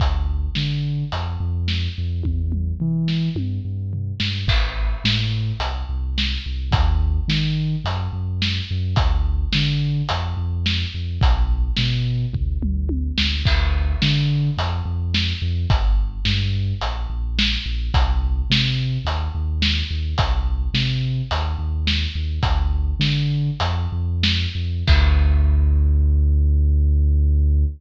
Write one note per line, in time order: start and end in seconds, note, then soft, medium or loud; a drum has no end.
0.00 0.47 D2 medium
0.00 kick loud
0.00 closed hi-hat medium
0.55 1.04 D3 medium
0.55 snare medium
1.12 1.37 F2 medium
1.12 closed hi-hat medium
1.40 1.88 F2 medium
1.68 snare medium
1.98 2.22 F2 medium
2.23 2.73 E2 medium
2.23 kick medium
2.23 high tom medium
2.52 mid tom medium
2.80 3.29 E3 medium
2.80 floor tom medium
3.08 snare medium
3.35 3.59 G2 medium
3.35 high tom medium
3.65 4.12 G2 medium
3.93 floor tom medium
4.20 4.44 G2 medium
4.20 snare loud
4.47 4.95 A1 medium
4.47 kick loud
4.47 crash loud
5.04 5.52 A2 medium
5.04 snare loud
5.60 5.84 C2 medium
5.60 closed hi-hat loud
5.89 6.37 C2 medium
6.18 snare loud
6.46 6.70 C2 medium
6.71 7.19 D#2 medium
6.71 kick loud
6.71 closed hi-hat loud
7.28 7.76 D#3 medium
7.28 snare loud
7.84 8.08 F#2 medium
7.84 closed hi-hat medium
8.13 8.60 F#2 medium
8.42 snare loud
8.71 8.95 F#2 medium
8.96 9.45 D2 medium
8.96 kick loud
8.96 closed hi-hat loud
9.53 10.02 D3 medium
9.53 snare loud
10.09 10.34 F2 medium
10.09 closed hi-hat loud
10.37 10.85 F2 medium
10.66 snare loud
10.94 11.18 F2 medium
11.21 11.69 B1 medium
11.21 kick loud
11.21 closed hi-hat loud
11.77 12.26 B2 medium
11.77 snare loud
12.33 12.57 D2 medium
12.33 kick medium
12.33 floor tom medium
12.63 13.10 D2 medium
12.63 mid tom medium
12.89 high tom medium
13.18 13.42 D2 medium
13.18 snare loud
13.45 13.94 D2 medium
13.45 kick loud
13.45 crash loud
14.02 14.50 D3 medium
14.02 snare loud
14.57 14.81 F2 medium
14.57 closed hi-hat loud
14.85 15.33 F2 medium
15.14 snare loud
15.42 15.66 F2 medium
15.70 16.19 G1 medium
15.70 kick loud
15.70 closed hi-hat loud
16.25 16.73 G2 medium
16.25 snare loud
16.81 17.06 A#1 medium
16.81 closed hi-hat loud
17.10 17.57 A#1 medium
17.39 snare loud
17.66 17.90 A#1 medium
17.94 18.42 C2 medium
17.94 kick loud
17.94 closed hi-hat loud
18.50 18.98 C3 medium
18.50 snare loud
19.05 19.29 D#2 medium
19.05 closed hi-hat loud
19.35 19.82 D#2 medium
19.62 snare loud
19.91 20.14 D#2 medium
20.18 20.67 C2 medium
20.18 kick loud
20.18 closed hi-hat loud
20.74 21.21 C3 medium
20.74 snare loud
21.31 21.55 D#2 medium
21.31 closed hi-hat loud
21.59 22.06 D#2 medium
21.87 snare loud
22.15 22.39 D#2 medium
22.43 22.92 D2 medium
22.43 kick loud
22.43 closed hi-hat loud
22.99 23.50 D3 medium
22.99 snare loud
23.60 23.87 F2 medium
23.60 closed hi-hat loud
23.92 24.46 F2 medium
24.23 snare loud
24.55 24.83 F2 medium
24.87 27.65 D2 loud
24.87 kick loud
24.87 crash loud